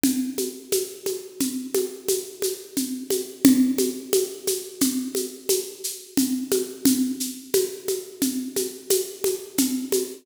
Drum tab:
SH |xxxxxxxxxx|xxxxxxxxxx|xxxxxxxxxx|
CG |OoooOoooOo|OoooOoo-Oo|O-ooOoooOo|